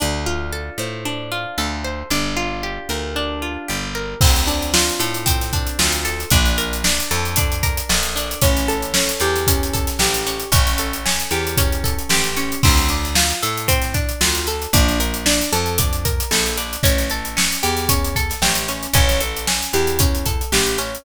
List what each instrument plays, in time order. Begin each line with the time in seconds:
0.00 electric bass (finger) D2, acoustic guitar (steel) D4
0.26 acoustic guitar (steel) F4
0.53 acoustic guitar (steel) A4
0.78 electric bass (finger) A2, acoustic guitar (steel) C5
1.05 acoustic guitar (steel) D4
1.32 acoustic guitar (steel) F4
1.58 electric bass (finger) D2, acoustic guitar (steel) A4
1.84 acoustic guitar (steel) C5
2.10 electric bass (finger) G1, acoustic guitar (steel) D4
2.37 acoustic guitar (steel) F4
2.63 acoustic guitar (steel) G4
2.89 electric bass (finger) D2, acoustic guitar (steel) A#4
3.16 acoustic guitar (steel) D4
3.42 acoustic guitar (steel) F4
3.68 electric bass (finger) G1, acoustic guitar (steel) G4
3.95 acoustic guitar (steel) A#4
4.21 electric bass (finger) D2, acoustic guitar (steel) C4, kick, crash
4.35 snare, closed hi-hat
4.47 acoustic guitar (steel) D4, closed hi-hat
4.62 closed hi-hat
4.74 acoustic guitar (steel) F4, snare
4.89 closed hi-hat
5.00 electric bass (finger) A2, acoustic guitar (steel) A4, closed hi-hat
5.14 closed hi-hat
5.26 acoustic guitar (steel) C4, kick, closed hi-hat
5.41 snare, closed hi-hat
5.53 acoustic guitar (steel) D4, kick, closed hi-hat
5.67 closed hi-hat
5.79 electric bass (finger) D2, acoustic guitar (steel) F4, snare
5.92 snare, closed hi-hat
6.05 acoustic guitar (steel) A4, closed hi-hat
6.20 closed hi-hat
6.30 electric bass (finger) A#1, acoustic guitar (steel) D4, kick, closed hi-hat
6.45 snare, closed hi-hat
6.58 acoustic guitar (steel) A#4, closed hi-hat
6.73 closed hi-hat
6.84 acoustic guitar (steel) D4, snare
6.99 snare, closed hi-hat
7.11 electric bass (finger) F2, acoustic guitar (steel) A4, closed hi-hat
7.25 closed hi-hat
7.36 acoustic guitar (steel) D4, kick, closed hi-hat
7.52 closed hi-hat
7.63 acoustic guitar (steel) A#4, kick, closed hi-hat
7.77 closed hi-hat
7.89 electric bass (finger) A#1, acoustic guitar (steel) A4, snare
8.03 closed hi-hat
8.16 acoustic guitar (steel) D4, closed hi-hat
8.31 closed hi-hat
8.42 electric bass (finger) A1, acoustic guitar (steel) C#4, kick, closed hi-hat
8.56 snare, closed hi-hat
8.68 acoustic guitar (steel) A4, closed hi-hat
8.82 closed hi-hat
8.94 acoustic guitar (steel) C#4, snare
9.09 snare, closed hi-hat
9.20 electric bass (finger) E2, acoustic guitar (steel) G4, closed hi-hat
9.36 snare, closed hi-hat
9.47 acoustic guitar (steel) C#4, kick, closed hi-hat
9.63 closed hi-hat
9.73 acoustic guitar (steel) A4, kick, closed hi-hat
9.87 snare, closed hi-hat
9.99 electric bass (finger) A1, acoustic guitar (steel) G4, snare
10.14 closed hi-hat
10.26 acoustic guitar (steel) C#4, snare, closed hi-hat
10.40 closed hi-hat
10.52 electric bass (finger) A1, acoustic guitar (steel) C#4, kick, closed hi-hat
10.67 snare, closed hi-hat
10.78 acoustic guitar (steel) A4, closed hi-hat
10.93 closed hi-hat
11.06 acoustic guitar (steel) C#4, snare
11.20 closed hi-hat
11.31 electric bass (finger) E2, acoustic guitar (steel) G4, closed hi-hat
11.47 closed hi-hat
11.57 acoustic guitar (steel) C#4, kick, closed hi-hat
11.72 closed hi-hat
11.84 acoustic guitar (steel) A4, kick, closed hi-hat
11.99 closed hi-hat
12.09 electric bass (finger) A1, acoustic guitar (steel) G4, snare
12.24 snare, closed hi-hat
12.37 acoustic guitar (steel) C#4, closed hi-hat
12.52 closed hi-hat
12.63 electric bass (finger) D2, acoustic guitar (steel) C4, kick, crash
12.77 snare, closed hi-hat
12.89 acoustic guitar (steel) D4, closed hi-hat
13.05 closed hi-hat
13.15 acoustic guitar (steel) F4, snare
13.30 closed hi-hat
13.43 electric bass (finger) A2, acoustic guitar (steel) A4, closed hi-hat
13.57 closed hi-hat
13.68 acoustic guitar (steel) C4, kick, closed hi-hat
13.82 snare, closed hi-hat
13.94 acoustic guitar (steel) D4, kick, closed hi-hat
14.09 closed hi-hat
14.21 electric bass (finger) D2, acoustic guitar (steel) F4, snare
14.35 snare, closed hi-hat
14.47 acoustic guitar (steel) A4, closed hi-hat
14.62 closed hi-hat
14.73 electric bass (finger) A#1, acoustic guitar (steel) D4, kick, closed hi-hat
14.88 snare, closed hi-hat
15.00 acoustic guitar (steel) A#4, closed hi-hat
15.14 closed hi-hat
15.26 acoustic guitar (steel) D4, snare
15.40 snare, closed hi-hat
15.53 electric bass (finger) F2, acoustic guitar (steel) A4, closed hi-hat
15.66 closed hi-hat
15.78 acoustic guitar (steel) D4, kick, closed hi-hat
15.93 closed hi-hat
16.05 acoustic guitar (steel) A#4, kick, closed hi-hat
16.20 closed hi-hat
16.31 electric bass (finger) A#1, acoustic guitar (steel) A4, snare
16.46 closed hi-hat
16.57 acoustic guitar (steel) D4, closed hi-hat
16.73 closed hi-hat
16.83 electric bass (finger) A1, acoustic guitar (steel) C#4, kick, closed hi-hat
16.98 snare, closed hi-hat
17.10 acoustic guitar (steel) A4, closed hi-hat
17.25 closed hi-hat
17.37 acoustic guitar (steel) C#4, snare
17.50 snare, closed hi-hat
17.63 electric bass (finger) E2, acoustic guitar (steel) G4, closed hi-hat
17.77 snare, closed hi-hat
17.89 acoustic guitar (steel) C#4, kick, closed hi-hat
18.04 closed hi-hat
18.16 acoustic guitar (steel) A4, kick, closed hi-hat
18.30 snare, closed hi-hat
18.42 electric bass (finger) A1, acoustic guitar (steel) G4, snare
18.55 closed hi-hat
18.68 acoustic guitar (steel) C#4, snare, closed hi-hat
18.83 closed hi-hat
18.93 electric bass (finger) A1, acoustic guitar (steel) C#4, kick, closed hi-hat
19.09 snare, closed hi-hat
19.21 acoustic guitar (steel) A4, closed hi-hat
19.37 closed hi-hat
19.47 acoustic guitar (steel) C#4, snare
19.63 closed hi-hat
19.73 electric bass (finger) E2, acoustic guitar (steel) G4, closed hi-hat
19.87 closed hi-hat
19.99 acoustic guitar (steel) C#4, kick, closed hi-hat
20.15 closed hi-hat
20.26 acoustic guitar (steel) A4, kick, closed hi-hat
20.41 closed hi-hat
20.52 electric bass (finger) A1, acoustic guitar (steel) G4, snare
20.67 snare, closed hi-hat
20.78 acoustic guitar (steel) C#4, closed hi-hat
20.95 closed hi-hat